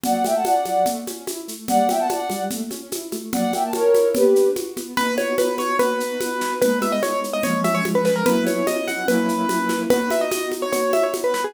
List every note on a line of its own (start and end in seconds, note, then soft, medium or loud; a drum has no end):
0.04 0.23 F#3 medium
0.04 0.23 D5 medium
0.04 0.23 F#5 medium
0.04 low conga medium
0.04 shaker medium
0.24 0.43 A3 medium
0.24 0.34 E5 medium
0.24 0.34 G5 medium
0.24 high conga soft
0.24 shaker medium
0.35 0.45 F#5 medium
0.35 0.45 A5 medium
0.45 0.64 C#4 medium
0.45 0.85 D5 medium
0.45 0.85 F#5 medium
0.45 high conga medium
0.45 shaker medium
0.65 0.84 F#3 medium
0.65 high conga soft
0.65 shaker soft
0.86 1.05 A3 medium
0.86 low conga medium
0.86 shaker medium
1.07 1.25 C#4 medium
1.07 high conga soft
1.07 shaker medium
1.27 1.46 E4 medium
1.27 high conga medium
1.27 shaker medium
1.48 1.66 A3 medium
1.48 shaker medium
1.68 1.87 G3 medium
1.68 1.87 D5 medium
1.68 1.87 F#5 medium
1.68 low conga medium
1.68 shaker medium
1.89 2.07 B3 medium
1.89 1.99 E5 medium
1.89 1.99 G5 medium
1.89 high conga medium
1.89 shaker medium
1.99 2.09 F#5 medium
1.99 2.09 A5 medium
2.09 2.28 D4 medium
2.09 2.42 D5 medium
2.09 2.42 F#5 medium
2.09 high conga medium
2.09 shaker medium
2.30 2.49 G3 medium
2.30 high conga soft
2.30 shaker medium
2.50 2.69 A3 medium
2.50 low conga medium
2.50 shaker medium
2.71 2.90 C#4 medium
2.71 high conga soft
2.71 shaker medium
2.92 3.10 E4 medium
2.92 high conga medium
2.92 shaker medium
3.12 3.31 A3 medium
3.12 high conga medium
3.12 shaker soft
3.33 3.51 F#3 medium
3.33 3.52 D5 medium
3.33 3.52 F#5 medium
3.33 low conga medium
3.33 shaker medium
3.53 3.72 A#3 medium
3.53 3.63 E5 medium
3.53 3.63 G5 medium
3.53 high conga soft
3.53 shaker medium
3.64 3.73 A5 medium
3.73 3.92 C#4 medium
3.73 4.08 A#4 medium
3.73 4.08 C#5 medium
3.73 high conga medium
3.73 shaker medium
3.94 4.13 E4 medium
3.94 high conga medium
3.94 shaker medium
4.15 4.33 B3 loud
4.15 4.49 G4 medium
4.15 4.49 B4 medium
4.15 low conga medium
4.15 shaker medium
4.36 4.54 D4 medium
4.36 shaker medium
4.56 4.75 F#4 medium
4.56 high conga medium
4.56 shaker medium
4.77 4.95 B3 medium
4.77 high conga medium
4.77 shaker soft
4.97 5.71 B3 medium
4.97 5.71 D#4 medium
4.97 5.71 F#4 medium
4.97 5.15 B4 medium
4.97 low conga medium
4.97 shaker medium
5.18 5.35 C#5 medium
5.18 high conga medium
5.18 shaker soft
5.38 5.55 B4 medium
5.38 high conga medium
5.38 shaker medium
5.58 5.76 C#5 medium
5.58 high conga medium
5.58 shaker soft
5.79 6.53 B3 medium
5.79 6.53 D#4 medium
5.79 6.53 F#4 medium
5.79 6.53 B4 medium
5.79 low conga medium
5.79 shaker medium
6.00 shaker medium
6.21 high conga medium
6.21 shaker medium
6.41 snare soft
6.41 shaker soft
6.61 6.99 G#3 medium
6.61 6.99 B3 medium
6.61 6.99 D#4 medium
6.61 6.79 B4 medium
6.61 low conga medium
6.61 shaker medium
6.82 6.92 E5 medium
6.82 high conga medium
6.82 shaker soft
6.92 7.02 D#5 medium
7.03 7.40 G#3 medium
7.03 7.40 B3 medium
7.03 7.40 D#4 medium
7.03 7.20 C#5 medium
7.03 high conga medium
7.03 shaker medium
7.24 shaker soft
7.33 7.43 D#5 medium
7.43 7.81 F3 medium
7.43 7.81 G#3 medium
7.43 7.81 C#4 loud
7.43 7.60 C#5 medium
7.43 low conga medium
7.43 shaker medium
7.64 7.74 E5 medium
7.64 high conga medium
7.64 shaker medium
7.75 7.84 C#5 medium
7.85 8.22 F3 medium
7.85 8.22 G#3 medium
7.85 8.22 C#4 medium
7.85 high conga medium
7.85 shaker soft
7.95 8.05 B4 medium
8.05 8.15 B4 medium
8.05 snare soft
8.05 shaker soft
8.16 8.25 A#4 medium
8.26 8.63 F#3 medium
8.26 8.63 B3 medium
8.26 8.63 C#4 medium
8.26 8.63 E4 medium
8.26 8.45 B4 medium
8.26 low conga medium
8.26 shaker medium
8.46 8.66 C#5 soft
8.46 high conga medium
8.46 shaker medium
8.67 9.04 F#3 medium
8.67 9.04 B3 medium
8.67 9.04 C#4 medium
8.67 9.04 E4 medium
8.67 8.87 D#5 medium
8.67 high conga medium
8.67 shaker medium
8.88 9.06 F#5 medium
8.88 high conga soft
8.88 shaker soft
9.08 9.45 F#3 medium
9.08 9.45 A#3 medium
9.08 9.45 C#4 medium
9.08 9.45 E4 loud
9.08 9.80 B4 medium
9.08 low conga medium
9.08 shaker medium
9.29 shaker soft
9.49 9.86 F#3 medium
9.49 9.86 A#3 medium
9.49 9.86 C#4 medium
9.49 9.86 E4 medium
9.49 high conga medium
9.49 shaker medium
9.69 snare soft
9.69 high conga soft
9.69 shaker soft
9.90 10.64 B3 medium
9.90 10.64 D#4 medium
9.90 10.64 F#4 medium
9.90 10.10 B4 medium
9.90 low conga medium
9.90 shaker medium
10.10 10.21 E5 medium
10.10 high conga medium
10.10 shaker medium
10.21 10.31 D#5 medium
10.31 10.49 D#5 medium
10.31 high conga medium
10.31 shaker medium
10.52 high conga soft
10.52 shaker soft
10.62 10.72 C#5 medium
10.73 11.46 B3 medium
10.73 11.46 D#4 medium
10.73 11.46 F#4 medium
10.73 10.92 C#5 medium
10.73 low conga medium
10.73 shaker medium
10.93 11.03 E5 medium
10.93 high conga medium
10.93 shaker soft
11.03 11.13 C#5 soft
11.14 high conga medium
11.14 shaker medium
11.24 11.34 B4 medium
11.34 11.44 B4 medium
11.34 snare soft
11.34 shaker soft
11.44 11.54 G#4 medium